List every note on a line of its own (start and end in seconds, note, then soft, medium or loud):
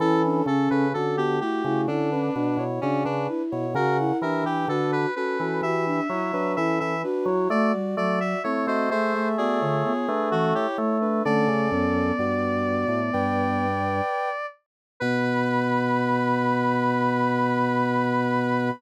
0.00 0.42 E3 loud
0.00 0.45 C#4 loud
0.00 0.22 E4 medium
0.00 0.22 A4 medium
0.00 0.45 A4 loud
0.24 0.46 D4 medium
0.46 0.68 C#3 loud
0.46 0.85 C#4 medium
0.46 0.88 C#4 loud
0.46 0.69 A4 medium
0.46 0.88 A4 loud
0.70 0.93 C#3 loud
0.70 0.93 B4 medium
0.93 1.41 D3 medium
0.93 1.16 C#4 medium
0.93 1.38 F#4 medium
0.93 1.16 A4 medium
1.17 1.39 B3 medium
1.17 1.39 G4 loud
1.17 1.39 G4 medium
1.41 1.63 A3 medium
1.41 1.63 E4 medium
1.41 1.63 F#4 medium
1.41 1.81 G4 medium
1.64 1.87 C#3 loud
1.64 1.87 A3 medium
1.64 1.87 E4 loud
1.64 1.87 F#4 medium
1.87 2.30 D3 loud
1.87 2.10 C#4 medium
1.87 2.64 D4 medium
1.87 2.10 E4 medium
1.87 2.10 A4 loud
2.11 2.34 C#4 medium
2.11 2.34 D4 medium
2.11 2.34 B4 medium
2.35 2.57 B2 medium
2.35 2.57 D4 medium
2.35 2.57 B4 medium
2.57 2.79 B2 loud
2.57 2.80 E4 medium
2.57 2.80 C#5 medium
2.81 3.05 C#3 loud
2.81 3.04 C#4 medium
2.81 3.04 D4 medium
2.81 3.03 F#4 medium
2.81 3.03 D5 medium
3.04 3.28 C#3 loud
3.04 3.42 D4 medium
3.04 3.27 D4 medium
3.04 3.42 B4 medium
3.28 3.66 E4 medium
3.51 3.75 B2 medium
3.51 3.74 E4 medium
3.51 3.74 C#5 medium
3.74 4.12 C#3 loud
3.74 3.98 F#4 medium
3.74 4.17 A#4 medium
3.74 3.97 A#4 medium
3.74 4.17 F#5 medium
3.99 4.21 E4 loud
4.21 4.43 E3 medium
4.21 4.65 D4 medium
4.21 4.44 G4 medium
4.21 4.44 A#4 medium
4.21 4.44 E5 medium
4.44 4.66 E3 medium
4.44 4.68 G4 medium
4.44 4.68 B4 medium
4.44 4.68 G5 medium
4.68 5.06 D3 loud
4.68 5.07 D4 medium
4.68 5.11 F#4 medium
4.68 4.91 A4 medium
4.68 5.07 B4 medium
4.92 5.14 B4 medium
5.15 5.38 C#4 medium
5.15 5.37 F#4 medium
5.15 5.38 A4 medium
5.15 5.61 B4 medium
5.39 5.61 E3 medium
5.39 5.62 C#4 medium
5.39 5.62 F#4 medium
5.39 5.62 A4 medium
5.62 6.00 E3 loud
5.62 5.85 F#4 medium
5.62 6.01 G4 medium
5.62 6.01 E5 medium
5.62 6.53 E5 medium
5.86 6.08 D4 medium
6.09 6.32 F#3 medium
6.09 6.31 E4 medium
6.09 6.32 E4 medium
6.09 6.31 C#5 loud
6.33 6.56 F#3 medium
6.33 6.55 D4 loud
6.33 6.55 B4 loud
6.56 6.80 E3 loud
6.56 6.94 C#4 medium
6.56 6.79 E4 medium
6.56 6.94 A4 medium
6.56 6.79 E5 medium
6.80 7.04 E3 medium
6.80 7.02 E5 medium
7.03 7.26 D4 medium
7.03 7.48 F#4 medium
7.03 7.26 B4 loud
7.26 7.48 F#3 loud
7.26 7.49 E4 medium
7.26 7.49 C#5 medium
7.50 7.72 A3 loud
7.50 7.73 A3 loud
7.50 7.95 F#4 medium
7.50 7.72 D5 medium
7.50 7.95 D5 medium
7.73 7.95 G3 medium
7.97 8.35 F#3 medium
7.97 8.19 A3 medium
7.97 8.39 F#4 medium
7.97 8.19 D5 medium
7.97 8.39 D5 medium
8.20 8.43 E5 medium
8.44 8.67 A3 medium
8.44 8.88 C4 medium
8.44 8.66 E4 medium
8.44 8.66 C#5 medium
8.67 8.89 A3 loud
8.67 8.90 F#4 medium
8.67 8.89 C5 medium
8.67 8.90 D#5 medium
8.90 9.93 A3 loud
8.90 9.13 A3 medium
8.90 9.13 G#4 medium
8.90 9.28 C5 medium
8.90 9.13 E5 loud
9.14 9.36 A3 medium
9.14 9.36 G#4 medium
9.14 9.36 E5 loud
9.38 9.60 B3 medium
9.38 9.60 F#4 loud
9.38 10.29 G#4 medium
9.38 9.60 D5 loud
9.61 9.83 D3 medium
9.61 9.83 F4 medium
9.61 9.83 C#5 loud
9.84 10.07 B3 medium
9.84 10.07 F4 medium
9.84 10.07 C#5 medium
10.08 10.67 A3 loud
10.08 10.30 D4 medium
10.08 10.30 B4 medium
10.31 10.53 E3 medium
10.31 10.54 C#4 medium
10.31 10.54 F#4 medium
10.31 10.54 A4 medium
10.55 10.97 E4 medium
10.55 10.77 G4 medium
10.55 10.97 C#5 medium
10.78 11.23 A3 loud
10.78 11.21 A3 medium
11.01 11.23 D4 medium
11.01 11.23 B4 medium
11.25 11.48 D3 loud
11.25 11.68 A3 loud
11.25 12.12 C#4 loud
11.25 12.12 A4 loud
11.25 14.46 D5 medium
11.48 11.70 C#3 medium
11.71 12.12 F#2 loud
11.71 13.66 B3 medium
12.19 12.85 G2 medium
12.19 13.00 F#4 medium
12.19 13.00 D5 loud
12.88 13.10 A2 medium
13.13 14.01 G2 loud
13.13 14.29 B4 medium
13.13 14.29 G5 loud
15.00 18.71 B2 loud
15.00 18.70 B3 loud
15.00 18.70 B4 loud
15.00 18.70 B5 loud